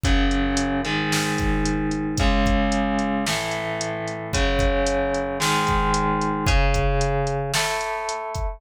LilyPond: <<
  \new Staff \with { instrumentName = "Overdriven Guitar" } { \time 4/4 \key cis \minor \tempo 4 = 112 <fis, cis fis>4. <gis, dis gis>2~ <gis, dis gis>8 | <cis, cis gis>2 <a, e a>2 | <fis, cis fis>2 <gis, dis gis>2 | <cis cis' gis'>2 <a e' a'>2 | }
  \new DrumStaff \with { instrumentName = "Drums" } \drummode { \time 4/4 <hh bd>8 hh8 hh8 hh8 sn8 <hh bd>8 hh8 hh8 | <hh bd>8 <hh bd>8 hh8 hh8 sn8 hh8 hh8 hh8 | <hh bd>8 <hh bd>8 hh8 hh8 sn8 <hh bd>8 hh8 hh8 | <hh bd>8 <hh bd>8 hh8 hh8 sn8 hh8 hh8 <hh bd>8 | }
>>